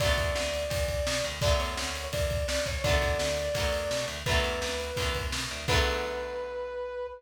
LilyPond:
<<
  \new Staff \with { instrumentName = "Brass Section" } { \time 4/4 \key b \minor \tempo 4 = 169 d''1 | d''8 cis''4. d''4 d''8 cis''8 | d''1 | b'2. r4 |
b'1 | }
  \new Staff \with { instrumentName = "Overdriven Guitar" } { \time 4/4 \key b \minor <d fis a b>1 | <d fis a b>1 | <d fis a b>2 <d fis a b>2 | <d fis a b>2 <d fis a b>2 |
<d fis a b>1 | }
  \new Staff \with { instrumentName = "Electric Bass (finger)" } { \clef bass \time 4/4 \key b \minor b,,8 e,8 d,4 e,4 b,8 d,8 | b,,8 e,8 d,4 e,4 cis,8 c,8 | b,,8 e,8 d,4 e,4 b,8 d,8 | b,,8 e,8 d,4 e,4 b,8 d,8 |
b,,1 | }
  \new DrumStaff \with { instrumentName = "Drums" } \drummode { \time 4/4 <bd cymr>8 <bd cymr>8 sn8 cymr8 <bd cymr>8 <bd cymr>8 sn8 cymr8 | <bd cymr>8 cymr8 sn8 cymr8 <bd cymr>8 <bd cymr>8 sn8 <bd cymr>8 | <bd cymr>8 <bd cymr>8 sn8 cymr8 <bd cymr>8 cymr8 sn8 cymr8 | <bd cymr>8 cymr8 sn8 cymr8 <bd cymr>8 <bd cymr>8 sn8 cymr8 |
<cymc bd>4 r4 r4 r4 | }
>>